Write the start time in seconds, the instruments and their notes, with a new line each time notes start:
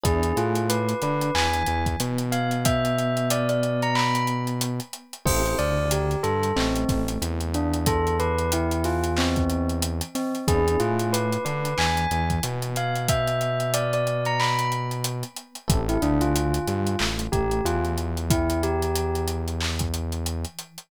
0.04 synth bass 1 E2, electric piano 1 B3 D4 E4 G#4, tubular bells G#4, kick, closed hi-hat
0.23 closed hi-hat
0.36 synth bass 1 A2, electric piano 1 A3, tubular bells F4, closed hi-hat
0.55 closed hi-hat
0.70 tubular bells B4, closed hi-hat
0.89 closed hi-hat
1.02 synth bass 1 D3, electric piano 1 D4, tubular bells B4, closed hi-hat
1.21 closed hi-hat
1.35 synth bass 1 E2, electric piano 1 E3, tubular bells G#5, clap
1.54 closed hi-hat
1.66 synth bass 1 E2, electric piano 1 E3, closed hi-hat
1.86 kick, closed hi-hat
2.00 synth bass 1 B2, electric piano 1 B3, closed hi-hat
2.18 closed hi-hat
2.32 tubular bells F5, closed hi-hat
2.51 closed hi-hat
2.65 tubular bells E5, kick, closed hi-hat
2.85 closed hi-hat
2.99 closed hi-hat
3.17 closed hi-hat
3.30 tubular bells D5, closed hi-hat
3.49 tubular bells D5, closed hi-hat
3.63 closed hi-hat
3.82 tubular bells A#5, closed hi-hat
3.95 tubular bells B5, clap
4.15 closed hi-hat
4.27 closed hi-hat
4.47 closed hi-hat
4.61 closed hi-hat
4.80 closed hi-hat
4.93 closed hi-hat
5.13 closed hi-hat
5.26 synth bass 1 A1, electric piano 1 C4 E4 G4 A4, tubular bells C5, kick, crash
5.46 closed hi-hat
5.59 synth bass 1 D2, electric piano 1 D3, tubular bells D5, closed hi-hat
5.91 tubular bells G4, closed hi-hat
6.11 closed hi-hat
6.23 synth bass 1 G2, electric piano 1 G3, tubular bells A4, closed hi-hat
6.43 closed hi-hat
6.56 synth bass 1 A1, electric piano 1 A3, tubular bells C4, clap
6.76 closed hi-hat
6.89 synth bass 1 A1, electric piano 1 A3, kick, snare, closed hi-hat
7.08 closed hi-hat
7.22 synth bass 1 E2, electric piano 1 E3, closed hi-hat
7.40 closed hi-hat
7.54 tubular bells D4, closed hi-hat
7.74 closed hi-hat
7.86 tubular bells A4, kick, closed hi-hat
8.07 closed hi-hat
8.20 tubular bells B4, closed hi-hat
8.38 closed hi-hat
8.52 tubular bells E4, closed hi-hat
8.71 closed hi-hat
8.84 tubular bells F4, snare, closed hi-hat
9.04 closed hi-hat
9.17 tubular bells C4, clap
9.36 kick, closed hi-hat
9.50 closed hi-hat
9.69 closed hi-hat
9.82 closed hi-hat
10.01 closed hi-hat
10.15 tubular bells C4, snare, closed hi-hat
10.35 closed hi-hat
10.48 synth bass 1 E2, electric piano 1 B3 D4 E4 G#4, tubular bells G#4, kick, closed hi-hat
10.68 closed hi-hat
10.80 synth bass 1 A2, electric piano 1 A3, tubular bells F4, closed hi-hat
10.99 closed hi-hat
11.13 tubular bells B4, closed hi-hat
11.32 closed hi-hat
11.45 synth bass 1 D3, electric piano 1 D4, tubular bells B4, closed hi-hat
11.65 closed hi-hat
11.77 synth bass 1 E2, electric piano 1 E3, tubular bells G#5, clap
11.97 closed hi-hat
12.11 synth bass 1 E2, electric piano 1 E3, closed hi-hat
12.30 kick, closed hi-hat
12.43 synth bass 1 B2, electric piano 1 B3, closed hi-hat
12.62 closed hi-hat
12.76 tubular bells F5, closed hi-hat
12.96 closed hi-hat
13.09 tubular bells E5, kick, closed hi-hat
13.28 closed hi-hat
13.41 closed hi-hat
13.60 closed hi-hat
13.74 tubular bells D5, closed hi-hat
13.93 tubular bells D5, closed hi-hat
14.07 closed hi-hat
14.25 tubular bells A#5, closed hi-hat
14.40 tubular bells B5, clap
14.59 closed hi-hat
14.72 closed hi-hat
14.91 closed hi-hat
15.04 closed hi-hat
15.23 closed hi-hat
15.37 closed hi-hat
15.55 closed hi-hat
15.68 synth bass 1 A1, electric piano 1 C4 E4 G4 A4, kick, closed hi-hat
15.89 tubular bells E4, closed hi-hat
16.02 synth bass 1 D2, electric piano 1 D3, tubular bells D4, closed hi-hat
16.21 tubular bells F4, closed hi-hat
16.36 closed hi-hat
16.54 closed hi-hat
16.67 synth bass 1 G2, electric piano 1 G3, closed hi-hat
16.87 closed hi-hat
16.99 synth bass 1 A1, electric piano 1 A3, clap
17.19 closed hi-hat
17.32 synth bass 1 A1, electric piano 1 A3, tubular bells G4, kick, closed hi-hat
17.51 closed hi-hat
17.64 synth bass 1 E2, electric piano 1 E3, tubular bells F4, closed hi-hat
17.85 closed hi-hat
17.98 closed hi-hat
18.17 closed hi-hat
18.30 tubular bells E4, kick, closed hi-hat
18.50 closed hi-hat
18.63 tubular bells G4, closed hi-hat
18.82 closed hi-hat
18.96 closed hi-hat
19.15 closed hi-hat
19.28 closed hi-hat
19.48 closed hi-hat
19.61 clap
19.79 kick, closed hi-hat
19.94 closed hi-hat
20.12 closed hi-hat
20.26 closed hi-hat
20.45 closed hi-hat
20.59 closed hi-hat
20.78 closed hi-hat